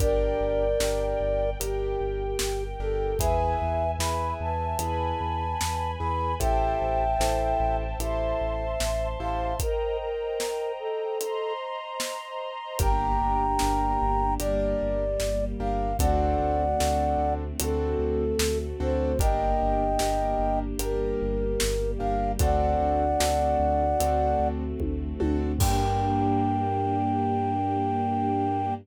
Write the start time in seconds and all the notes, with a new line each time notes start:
0.00 G1 D4 G4 A#4 D5 G5, kick, closed hi-hat
0.41 G1
0.80 G1 D4 G4 A#4, snare
1.21 G1
1.60 G1 D4 G4 A#4 G5, closed hi-hat
2.00 G1
2.39 G1, snare
2.80 G1 D4 G4 A4 A#4
3.19 E2 E4 G#4 B4 E5 G#5, kick, closed hi-hat
3.62 E2
3.99 E2 E4 G#4 B4 B5, snare
4.40 E2 A5
4.79 E2 E4 G#4 B4 G#5 B5, closed hi-hat
5.21 E2
5.61 E2, snare
6.00 E2 E4 G#4 B4 B5
6.39 A1 E4 G4 A4 C5 E5 G5 A5, kick, closed hi-hat
6.81 A1
7.19 A1 E4 G4 A4 C5, snare
7.60 A1
7.99 A1 E4 G4 A4 C5 E5 A5 C6, closed hi-hat
8.41 A1
8.80 A1, snare
9.19 A1 E4 G4 A4 C5 F5
9.60 A#4 C5 D#5 G5 A#5, kick, closed hi-hat
10.01 A#4
10.40 snare
10.79 A4
11.20 C5 D#5 A#5 C6, closed hi-hat
12.00 snare
12.79 G1 A#3 D4 G4 A#4 G5 A#5, kick, closed hi-hat
13.22 G1
13.59 G1 D4 G4 A#4, snare
14.02 G1
14.39 G1 G3 A#3 D4 G4 A#4 D5, closed hi-hat
14.82 G1
15.20 G1, snare
15.59 G1 D4 G4 A#4 F5
15.99 D2 A3 C4 D4 F#4 A4 D5 F#5, kick, closed hi-hat
16.40 D2
16.80 D2 C4 D4 F#4 A4, snare
17.18 D2
17.60 D2 A3 C4 D4 F#4 A4, closed hi-hat
17.99 D2
18.39 D2, snare
18.80 D2 C4 D4 F#4 A4 C5
19.19 G1 A#3 D4 G4 A#4 D#5 G5, kick, closed hi-hat
19.62 G1
19.99 G1 D4 G4 A#4, snare
20.39 G1
20.79 G1 G3 A#3 D4 G4 A#4, closed hi-hat
21.22 G1
21.60 G1, snare
21.99 G1 D4 G4 A#4 F5
22.39 D2 A3 C4 D4 F#4 A4 D5 F#5, kick, closed hi-hat
22.80 D2
23.20 D2 C4 D4 F#4 A4, snare
23.60 D2
24.00 D2 A3 C4 D4 F#4 A4, closed hi-hat
24.40 D2
24.79 D2, kick, high tom
25.20 D2 C4 D4 F#4 A4, high tom
25.59 G2 A#3 D4 G4 A#4 G5, kick, crash